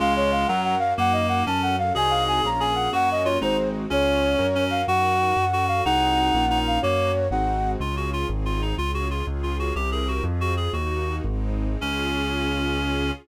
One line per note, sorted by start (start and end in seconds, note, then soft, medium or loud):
0.00 0.45 C#2 medium
0.00 0.47 G#3 loud
0.00 0.44 C#4 loud
0.00 0.48 C#4 medium
0.00 0.44 F4 loud
0.00 0.48 F4 medium
0.00 0.44 G#4 medium
0.00 0.48 G#4 medium
0.00 0.14 F5 loud
0.16 0.31 C#5 loud
0.32 0.47 F5 medium
0.47 0.93 F#2 medium
0.47 0.75 F#3 medium
0.47 0.93 C#4 medium
0.47 0.98 C#4 medium
0.47 0.93 F#4 loud
0.47 0.98 F#4 medium
0.47 0.93 A#4 medium
0.47 0.98 A#4 medium
0.47 0.61 F#5 medium
0.64 0.78 F#5 medium
0.79 0.94 F5 loud
0.98 1.43 F#2 medium
0.98 1.45 A#3 loud
0.98 1.47 D#4 medium
0.98 1.45 F#4 medium
0.98 1.47 A#4 medium
0.98 1.13 F#5 loud
1.12 1.27 D#5 medium
1.28 1.43 F#5 medium
1.46 1.92 F#2 medium
1.46 1.94 C#4 medium
1.46 1.76 C#4 medium
1.46 1.94 F#4 medium
1.46 1.94 A4 medium
1.46 1.61 A5 medium
1.62 1.76 F#5 medium
1.78 1.93 F5 loud
1.95 2.40 C2 medium
1.95 2.39 C4 medium
1.95 2.44 C4 medium
1.95 2.39 D#4 loud
1.95 2.44 D#4 medium
1.95 2.39 F#4 medium
1.95 2.44 F#4 medium
1.95 2.39 G#4 medium
1.95 2.48 G#4 loud
1.95 2.44 G#4 medium
1.95 2.12 G#5 loud
2.10 2.24 F5 medium
2.28 2.42 G#5 medium
2.43 2.89 A#1 medium
2.43 2.91 A#3 medium
2.43 2.88 A#3 loud
2.43 2.91 C#4 medium
2.43 2.88 C#4 medium
2.43 2.91 F4 medium
2.43 2.88 F4 medium
2.43 2.61 A#5 medium
2.60 2.91 G#4 medium
2.60 2.74 G#5 medium
2.75 2.89 F#5 medium
2.93 3.38 F#2 medium
2.93 3.37 A#3 medium
2.93 3.41 A#3 medium
2.93 3.37 C#4 medium
2.93 3.41 C#4 medium
2.93 3.23 F#4 medium
2.93 3.37 F#4 loud
2.93 3.40 F#4 medium
2.93 3.09 F#5 loud
3.11 3.27 D#5 loud
3.24 3.39 F4 medium
3.24 3.38 C#5 medium
3.41 3.87 G#1 medium
3.41 3.89 G#3 medium
3.41 3.85 G#3 medium
3.41 3.89 C4 medium
3.41 3.85 C4 medium
3.41 3.89 D#4 medium
3.41 3.85 D#4 loud
3.41 3.57 D#4 medium
3.41 3.89 F#4 medium
3.41 3.85 F#4 medium
3.41 3.69 C5 medium
3.90 4.36 C#2 medium
3.90 4.38 C#4 medium
3.90 4.46 C#4 loud
3.90 4.34 C#4 medium
3.90 4.38 F4 medium
3.90 4.34 F4 medium
3.90 4.38 G#4 medium
3.90 4.34 G#4 medium
3.90 4.64 C#5 loud
4.39 4.84 F#2 medium
4.39 4.83 C#4 medium
4.39 4.88 C#4 medium
4.39 4.83 F#4 medium
4.39 4.87 F#4 medium
4.39 4.83 A#4 medium
4.39 4.87 A#4 medium
4.55 4.82 C#4 medium
4.70 4.86 F5 medium
4.87 5.33 F#2 medium
4.87 5.36 D#4 medium
4.87 5.36 F#4 medium
4.87 5.45 F#4 loud
4.87 5.36 A#4 medium
4.87 5.66 F#5 loud
5.36 5.82 F#2 medium
5.36 5.84 C#4 medium
5.36 5.84 F#4 medium
5.36 5.84 A4 medium
5.53 5.84 F#4 medium
5.68 5.82 F5 medium
5.85 6.31 C2 medium
5.85 6.33 C4 medium
5.85 6.30 C4 medium
5.85 6.33 D#4 medium
5.85 6.45 D#4 loud
5.85 6.30 D#4 medium
5.85 6.33 F#4 medium
5.85 6.30 F#4 medium
5.85 6.33 G#4 medium
5.85 6.30 G#4 medium
5.85 6.59 F#5 loud
6.33 6.79 A#1 medium
6.33 6.81 A#3 medium
6.33 6.79 A#3 medium
6.33 6.81 C#4 medium
6.33 6.79 C#4 medium
6.33 6.81 F4 medium
6.33 6.79 F4 medium
6.50 6.79 D#4 medium
6.67 6.81 F5 medium
6.82 7.28 F#2 medium
6.82 7.12 A#3 loud
6.82 7.27 A#3 medium
6.82 7.32 A#3 medium
6.82 7.27 C#4 medium
6.82 7.32 C#4 medium
6.82 7.27 F#4 medium
6.82 7.32 F#4 medium
6.82 7.28 C#5 loud
7.31 7.76 G#1 medium
7.31 7.80 G#3 medium
7.31 7.76 G#3 medium
7.31 7.80 C4 medium
7.31 7.76 C4 medium
7.31 7.80 D#4 medium
7.31 7.76 D#4 medium
7.31 7.80 F#4 medium
7.31 7.76 F#4 medium
7.31 7.71 F#5 medium
7.80 8.25 C#2 medium
7.80 8.28 C#4 medium
7.80 8.28 F4 medium
7.80 7.95 F4 medium
7.80 8.28 G#4 medium
7.97 8.10 F#4 medium
8.13 8.27 F4 medium
8.29 8.74 G#1 medium
8.29 8.78 C4 medium
8.29 8.78 D#4 medium
8.29 8.77 G#4 medium
8.45 8.61 F4 medium
8.62 8.75 D#4 medium
8.78 9.23 C#2 medium
8.78 9.26 C#4 medium
8.78 9.26 F4 medium
8.78 8.91 F4 medium
8.78 9.26 G#4 medium
8.94 9.08 F#4 medium
9.11 9.26 F4 medium
9.27 9.72 C#2 medium
9.27 9.76 C#4 medium
9.27 9.76 F4 medium
9.27 9.76 G#4 medium
9.43 9.57 F4 medium
9.59 9.74 F#4 medium
9.75 10.21 C2 medium
9.75 10.24 C4 medium
9.75 10.24 E4 medium
9.75 10.24 G4 medium
9.75 9.90 G4 medium
9.75 10.24 A#4 medium
9.92 10.08 G#4 medium
10.08 10.24 F#4 medium
10.24 10.69 F2 medium
10.24 10.74 C4 medium
10.24 10.74 F4 medium
10.24 10.74 G#4 medium
10.41 10.54 F#4 medium
10.57 10.72 G#4 medium
10.73 11.20 D#2 medium
10.73 11.24 A#3 medium
10.73 11.24 D#4 medium
10.73 11.16 F#4 medium
10.73 11.24 F#4 medium
11.25 11.77 G#1 loud
11.25 11.82 G#3 medium
11.25 11.82 C4 medium
11.25 11.82 D#4 medium
11.81 13.11 C#2 medium
11.81 13.11 C#4 loud
11.81 13.12 C#4 loud
11.81 13.12 F4 loud
11.81 13.12 G#4 medium